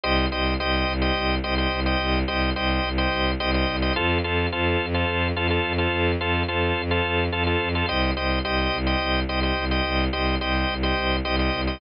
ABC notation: X:1
M:7/8
L:1/16
Q:1/4=107
K:Cdor
V:1 name="Violin" clef=bass
C,,2 C,,2 C,,2 C,,2 C,,2 C,,2 C,,2 | C,,2 C,,2 C,,2 C,,2 C,,2 C,,2 C,,2 | F,,2 F,,2 F,,2 F,,2 F,,2 F,,2 F,,2 | F,,2 F,,2 F,,2 F,,2 F,,2 F,,2 F,,2 |
C,,2 C,,2 C,,2 C,,2 C,,2 C,,2 C,,2 | C,,2 C,,2 C,,2 C,,2 C,,2 C,,2 C,,2 |]
V:2 name="Drawbar Organ"
[Gce]2 [Gce]2 [Gce]3 [Gce]3 [Gce] [Gce]2 [Gce]- | [Gce]2 [Gce]2 [Gce]3 [Gce]3 [Gce] [Gce]2 [Gce] | [FAc]2 [FAc]2 [FAc]3 [FAc]3 [FAc] [FAc]2 [FAc]- | [FAc]2 [FAc]2 [FAc]3 [FAc]3 [FAc] [FAc]2 [FAc] |
[Gce]2 [Gce]2 [Gce]3 [Gce]3 [Gce] [Gce]2 [Gce]- | [Gce]2 [Gce]2 [Gce]3 [Gce]3 [Gce] [Gce]2 [Gce] |]